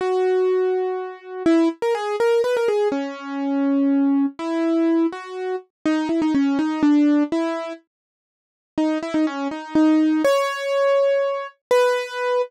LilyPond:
\new Staff { \time 6/8 \key gis \minor \tempo 4. = 82 fis'2. | e'8 r16 ais'16 gis'8 ais'8 b'16 ais'16 gis'8 | cis'2. | e'4. fis'4 r8 |
\key b \major dis'8 e'16 dis'16 cis'8 dis'8 d'4 | e'4 r2 | dis'8 e'16 dis'16 cis'8 dis'8 dis'4 | cis''2. |
b'4. r4. | }